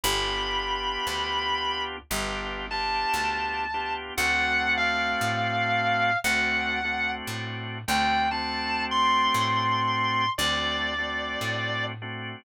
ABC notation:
X:1
M:4/4
L:1/8
Q:"Swing" 1/4=58
K:D
V:1 name="Distortion Guitar"
b4 z a3 | f ^e3 f2 z g | a =c'3 d3 z |]
V:2 name="Drawbar Organ"
[B,D=FG]4 [B,DFG] [B,DFG]2 [B,DFG] | [A,=CDF]4 [A,CDF] [A,CDF]2 [A,CDF] | [A,=CDF]4 [A,CDF] [A,CDF]2 [A,CDF] |]
V:3 name="Electric Bass (finger)" clef=bass
G,,,2 D,,2 G,,,2 D,,2 | D,,2 A,,2 D,,2 A,, D,,- | D,,2 A,,2 D,,2 A,,2 |]